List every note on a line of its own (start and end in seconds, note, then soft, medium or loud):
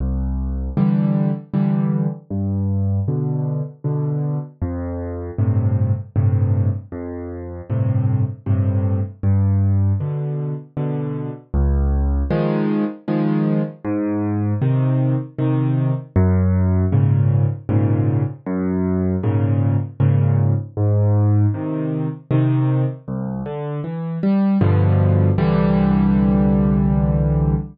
0.00 0.70 C2 medium
0.77 1.31 D3 medium
0.77 1.31 E3 medium
0.77 1.31 G3 medium
1.54 2.07 D3 medium
1.54 2.07 E3 medium
1.54 2.07 G3 medium
2.30 3.00 G2 medium
3.08 3.62 B2 medium
3.08 3.62 D3 medium
3.84 4.38 B2 medium
3.84 4.38 D3 medium
4.62 5.31 F2 medium
5.38 5.92 G2 medium
5.38 5.92 A2 medium
5.38 5.92 C3 medium
6.16 6.70 G2 medium
6.16 6.70 A2 medium
6.16 6.70 C3 medium
6.92 7.61 F2 medium
7.70 8.23 G2 medium
7.70 8.23 A2 medium
7.70 8.23 C3 medium
8.46 9.00 G2 medium
8.46 9.00 A2 medium
8.46 9.00 C3 medium
9.23 9.93 G2 medium
10.00 10.54 B2 medium
10.00 10.54 D3 medium
10.77 11.31 B2 medium
10.77 11.31 D3 medium
11.54 12.23 C#2 loud
12.30 12.84 D#3 medium
12.30 12.84 F3 medium
12.30 12.84 G#3 medium
13.08 13.62 D#3 medium
13.08 13.62 F3 medium
13.08 13.62 G#3 medium
13.85 14.54 G#2 loud
14.62 15.15 C3 medium
14.62 15.15 D#3 medium
15.38 15.92 C3 medium
15.38 15.92 D#3 medium
16.16 16.85 F#2 loud
16.92 17.46 G#2 medium
16.92 17.46 A#2 medium
16.92 17.46 C#3 medium
17.69 18.23 G#2 medium
17.69 18.23 A#2 medium
17.69 18.23 C#3 medium
18.46 19.16 F#2 loud
19.23 19.77 G#2 medium
19.23 19.77 A#2 medium
19.23 19.77 C#3 medium
20.00 20.54 G#2 medium
20.00 20.54 A#2 medium
20.00 20.54 C#3 medium
20.77 21.46 G#2 loud
21.54 22.08 C3 medium
21.54 22.08 D#3 medium
22.31 22.84 C3 medium
22.31 22.84 D#3 medium
23.08 23.42 C2 medium
23.46 23.80 D3 medium
23.84 24.19 E3 medium
24.23 24.58 G3 medium
24.61 25.30 G2 loud
24.61 25.30 B2 loud
24.61 25.30 D3 medium
24.61 25.30 F3 medium
25.38 27.55 C2 medium
25.38 27.55 D3 medium
25.38 27.55 E3 medium
25.38 27.55 G3 loud